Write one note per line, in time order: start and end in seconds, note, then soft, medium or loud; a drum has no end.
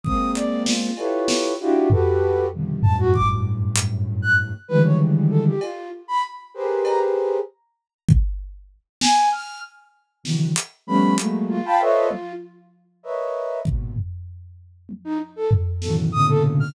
0.03 0.88 G#3 loud
0.03 0.88 A#3 loud
0.03 0.88 C4 loud
0.03 0.31 D#6 medium
0.03 kick medium
0.35 0.63 D5 medium
0.35 closed hi-hat medium
0.66 1.23 F4 medium
0.66 snare loud
0.97 1.53 E4 medium
0.97 1.53 F4 medium
0.97 1.53 G4 medium
0.97 1.53 A4 medium
0.97 1.53 B4 medium
0.97 1.53 C#5 medium
0.97 cowbell medium
1.28 snare loud
1.60 1.88 D4 loud
1.60 1.88 E4 loud
1.60 1.88 F4 loud
1.60 1.88 F#4 loud
1.60 1.88 G4 loud
1.90 2.46 F#4 medium
1.90 2.46 G4 medium
1.90 2.46 A4 medium
1.90 2.46 B4 medium
1.90 floor tom loud
2.52 2.80 B2 medium
2.52 2.80 C3 medium
2.52 2.80 D3 medium
2.52 2.80 D#3 medium
2.52 2.80 F3 medium
2.52 2.80 G3 medium
2.82 4.51 F#2 loud
2.82 4.51 G2 loud
2.82 4.51 A2 loud
2.82 2.96 A5 medium
2.82 floor tom loud
2.99 3.13 F#4 loud
3.14 3.28 D6 medium
3.14 kick medium
3.76 closed hi-hat loud
4.22 4.36 F#6 medium
4.68 5.52 D3 loud
4.68 5.52 D#3 loud
4.68 5.52 E3 loud
4.68 5.52 F3 loud
4.68 5.52 G3 loud
4.68 5.52 G#3 loud
4.68 4.82 B4 loud
4.84 4.98 C#5 medium
5.30 5.44 A4 medium
5.46 5.60 G4 medium
5.61 5.89 F4 medium
5.61 cowbell medium
6.08 6.22 B5 loud
6.54 7.38 G4 medium
6.54 7.38 G#4 medium
6.54 7.38 A#4 medium
6.54 7.38 B4 medium
6.54 7.38 C5 medium
6.85 6.99 A#5 medium
6.85 cowbell medium
8.09 kick loud
9.01 9.29 G#5 loud
9.01 snare loud
9.32 9.60 F6 medium
10.23 10.51 C3 medium
10.23 10.51 D3 medium
10.23 10.51 D#3 medium
10.23 10.51 E3 medium
10.23 10.51 F#3 medium
10.23 snare medium
10.56 closed hi-hat loud
10.87 11.15 F3 loud
10.87 11.15 G3 loud
10.87 11.15 A3 loud
10.87 11.15 B3 loud
10.87 11.15 C#4 loud
10.87 11.15 B5 medium
11.16 11.58 F#3 loud
11.16 11.58 G#3 loud
11.16 11.58 A3 loud
11.16 11.58 A#3 loud
11.16 closed hi-hat loud
11.49 12.32 F4 loud
11.65 11.79 F5 loud
11.65 11.79 G5 loud
11.65 11.79 A5 loud
11.65 11.79 B5 loud
11.80 12.07 A4 loud
11.80 12.07 B4 loud
11.80 12.07 C5 loud
11.80 12.07 C#5 loud
11.80 12.07 D#5 loud
11.80 12.07 E5 loud
12.11 high tom medium
13.03 13.59 A#4 medium
13.03 13.59 B4 medium
13.03 13.59 C#5 medium
13.03 13.59 D#5 medium
13.03 13.59 E5 medium
13.65 13.94 G#2 medium
13.65 13.94 A#2 medium
13.65 13.94 B2 medium
13.65 kick medium
13.96 floor tom medium
14.89 high tom medium
15.04 15.18 D#4 loud
15.36 15.50 A4 medium
15.51 floor tom loud
15.82 16.10 A2 medium
15.82 16.10 B2 medium
15.82 16.10 C#3 medium
15.82 16.10 D#3 medium
15.82 16.10 E3 medium
15.82 16.10 F#3 medium
15.82 15.95 A4 medium
15.82 snare medium
16.12 16.68 A2 loud
16.12 16.68 A#2 loud
16.12 16.68 B2 loud
16.12 16.68 C#3 loud
16.12 16.68 D3 loud
16.12 16.26 D#6 loud
16.29 16.43 A4 loud
16.60 16.74 F6 loud